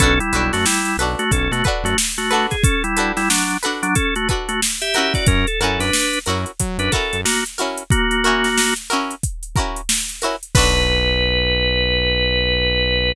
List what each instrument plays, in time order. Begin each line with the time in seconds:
0.00 synth bass 1 B1, drawbar organ C#4 A4, pizzicato strings D4 F#4 A4 B4, kick, closed hi-hat
0.20 drawbar organ G3 E4, closed hi-hat
0.33 synth bass 1 B1, pizzicato strings D4 F#4 A4 B4, closed hi-hat
0.53 synth bass 1 F#2, drawbar organ A3 F#4, snare, closed hi-hat
0.66 drawbar organ G3 E4, snare
0.85 closed hi-hat
0.97 synth bass 1 B1, pizzicato strings F#4 A4 B4, closed hi-hat
1.02 pizzicato strings D4
1.19 drawbar organ A3 F#4, closed hi-hat
1.31 synth bass 1 B1, drawbar organ C#4 A4, kick, closed hi-hat
1.51 synth bass 1 B2, drawbar organ A3 F#4, closed hi-hat
1.64 pizzicato strings D4 F#4 A4 B4, kick, closed hi-hat
1.83 synth bass 1 F#2, drawbar organ A3 F#4, closed hi-hat
1.98 snare
2.18 drawbar organ A3 F#4, closed hi-hat
2.30 pizzicato strings D4 F#4 A4 B4, closed hi-hat
2.50 drawbar organ G#4, kick, snare, closed hi-hat
2.64 drawbar organ C#4 A4, kick, closed hi-hat
2.84 drawbar organ G3 E4, closed hi-hat
2.97 pizzicato strings D4 F#4 A4 B4, closed hi-hat
3.17 drawbar organ G3 E4, snare, closed hi-hat
3.30 drawbar organ F#3 D4, snare
3.50 closed hi-hat
3.63 pizzicato strings D4 F#4 A4 B4, closed hi-hat
3.83 drawbar organ F#3 D4, closed hi-hat
3.95 drawbar organ C#4 A4, kick, closed hi-hat
4.16 drawbar organ A3 F#4, closed hi-hat
4.29 pizzicato strings D4 F#4 A4 B4, kick, closed hi-hat
4.48 drawbar organ A3 F#4, closed hi-hat
4.62 snare
4.82 drawbar organ G4 E5, closed hi-hat
4.94 pizzicato strings C#4 E4 F#4 A#4, closed hi-hat
5.14 drawbar organ F#4 D5, kick, snare, closed hi-hat
5.27 synth bass 1 F#2, drawbar organ C#4 A#4, kick, closed hi-hat
5.47 drawbar organ A4, closed hi-hat
5.60 synth bass 1 F#2, pizzicato strings C#4 E4 F#4 A#4, drawbar organ A4, closed hi-hat
5.79 synth bass 1 F#2, drawbar organ D4 B4, snare, closed hi-hat
5.93 snare
6.13 closed hi-hat
6.26 synth bass 1 F#2, pizzicato strings C#4 E4 F#4 A#4, closed hi-hat
6.46 closed hi-hat
6.59 synth bass 1 F#3, kick, closed hi-hat
6.78 synth bass 1 F#2, drawbar organ D4 B4, closed hi-hat
6.92 pizzicato strings C#4 E4 F#4 A#4, drawbar organ A4, kick, snare, closed hi-hat
7.13 synth bass 1 F#2, closed hi-hat
7.25 drawbar organ A#3 F#4, snare
7.46 closed hi-hat
7.58 pizzicato strings C#4 E4 F#4 A#4, closed hi-hat
7.77 closed hi-hat
7.90 drawbar organ A#3 F#4, kick, closed hi-hat
8.11 closed hi-hat
8.24 pizzicato strings C#4 E4 F#4 A#4, closed hi-hat
8.44 snare, closed hi-hat
8.58 snare
8.76 snare, closed hi-hat
8.90 pizzicato strings C#4 E4 F#4 A#4, closed hi-hat
9.11 closed hi-hat
9.23 kick, closed hi-hat
9.43 closed hi-hat
9.56 pizzicato strings C#4 E4 F#4 A#4, kick, closed hi-hat
9.76 closed hi-hat
9.89 snare
10.09 closed hi-hat
10.22 pizzicato strings C#4 E4 F#4 A#4, closed hi-hat
10.43 closed hi-hat
10.55 synth bass 1 B1, pizzicato strings D4 F#4 A4 B4, drawbar organ B4, kick, crash